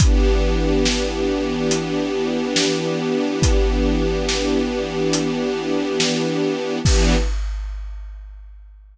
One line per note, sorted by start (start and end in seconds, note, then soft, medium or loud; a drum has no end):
0.00 6.79 E3 medium
0.00 6.79 B3 medium
0.00 6.79 D4 medium
0.00 6.79 G4 medium
0.00 kick loud
0.00 closed hi-hat loud
0.86 snare loud
1.71 closed hi-hat loud
2.56 snare loud
3.42 kick loud
3.42 closed hi-hat loud
4.29 snare loud
5.13 closed hi-hat loud
6.00 snare loud
6.85 7.15 E3 loud
6.85 7.15 B3 loud
6.85 7.15 D4 medium
6.85 7.15 G4 medium
6.85 kick loud
6.85 crash loud